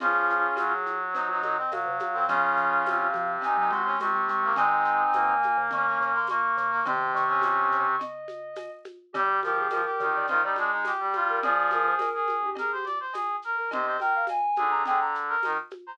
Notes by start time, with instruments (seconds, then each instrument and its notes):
0.00 marimba F2, brass section F3 C#4 F4, ocarina G#4, cowbell, low conga, shaker
0.29 marimba F2, shaker
0.56 brass section F#3, tambourine, cowbell, high conga, shaker
0.86 marimba F2, shaker
1.13 brass section D#4, ocarina C5, cowbell, low conga, shaker
1.29 marimba F#2, brass section D#4
1.42 marimba A#2, brass section D#4, ocarina D#5, high conga, shaker
1.57 brass section C4, ocarina D#5
1.71 marimba A#2, brass section F#3, ocarina F5, tambourine, cowbell, high conga, shaker
1.86 marimba C3
1.98 marimba G#2, ocarina F5, high conga, shaker
2.13 marimba A#2, brass section C4
2.28 brass section C#3 C#4 F4, marimba F3, ocarina F5, cowbell, low conga, shaker
2.57 marimba F3, shaker
2.84 brass section C3, tambourine, cowbell, high conga, shaker
3.14 marimba F3, high conga, shaker
3.41 brass section D#4, ocarina G#5, cowbell, low conga, shaker
3.57 marimba F#3, brass section D#4
3.71 marimba G#3, brass section F#4, ocarina C6, high conga, shaker
3.84 brass section C#4, ocarina C6
3.99 brass section C3, marimba G#3, ocarina C#6, tambourine, cowbell, high conga, shaker
4.14 marimba G#3
4.28 marimba G#3, ocarina C#6, shaker
4.43 marimba G#3, brass section A#3
4.56 marimba D#3, brass section G#3 C4 D#4, ocarina G#5, cowbell, low conga, shaker
4.85 shaker
5.13 marimba C3, brass section A#3, tambourine, cowbell, high conga, shaker
5.29 marimba C#3
5.43 high conga, shaker
5.57 marimba C#3
5.71 marimba D#3, brass section C#4, ocarina C#6, cowbell, low conga, shaker
5.86 brass section C#4
5.99 marimba C#3, brass section C#4, ocarina C#6, shaker
6.14 brass section A#3, ocarina C6
6.27 brass section A#3, ocarina C#6, tambourine, cowbell, high conga, shaker
6.57 marimba C#3, ocarina C#6, shaker
6.71 brass section A#3
6.85 brass section C3 C4, marimba D#3, ocarina C6, cowbell, low conga, shaker
7.14 marimba D#3, ocarina C#6, shaker
7.28 brass section C#4, ocarina C#6
7.42 tambourine, cowbell, high conga, shaker
7.71 marimba C#3, shaker
7.99 ocarina D#5, cowbell, low conga, shaker
8.28 high conga, shaker
8.56 tambourine, cowbell, high conga, shaker
8.85 high conga, shaker
9.13 marimba D3, brass section G3 G4, ocarina G4, cowbell, low conga, shaker
9.42 brass section F3 G4, ocarina A#4, high conga, shaker
9.58 ocarina G#4
9.70 brass section F3, ocarina A#4, tambourine, cowbell, high conga, shaker
9.85 brass section G4
10.00 marimba D3, brass section D#3, high conga, shaker
10.15 ocarina D5
10.27 brass section D#3 F4, ocarina C5, cowbell, low conga, shaker
10.43 brass section G3 D#4, ocarina D5
10.56 brass section G#3 D4, high conga, shaker
10.71 brass section D#4
10.85 brass section G4, tambourine, cowbell, high conga, shaker
11.00 brass section G3
11.13 brass section F4, high conga, shaker
11.29 ocarina A#4
11.42 marimba F2, brass section F3 G#4, ocarina D5, cowbell, low conga, shaker
11.70 brass section G#4, ocarina A#4, high conga, shaker
11.87 ocarina C5
11.99 marimba D2, ocarina A#4, tambourine, cowbell, high conga, shaker
12.14 brass section G#4
12.28 high conga, shaker
12.43 marimba D#2, ocarina G4
12.55 ocarina G#4, brass section A#4, cowbell, low conga, shaker
12.72 ocarina G4, brass section C5
12.85 brass section D5, high conga, shaker
13.00 brass section C5
13.13 brass section G#4, tambourine, cowbell, high conga, shaker
13.42 brass section A#4, shaker
13.56 ocarina A#4
13.71 marimba D#2, brass section C3 C5, ocarina D#5, cowbell, low conga, shaker
13.86 brass section C5
14.00 brass section A#4, ocarina G5, high conga, shaker
14.15 ocarina F5
14.27 ocarina G#5, tambourine, cowbell, high conga, shaker
14.56 marimba D#2, brass section D3 G#4, high conga, shaker
14.71 ocarina A#5
14.85 brass section D3 G#4, ocarina G5, cowbell, low conga, shaker
15.01 ocarina A#5
15.15 shaker
15.28 brass section A#4
15.43 brass section D#3, tambourine, cowbell, high conga, shaker
15.70 high conga, shaker
15.87 brass section C5, ocarina A#5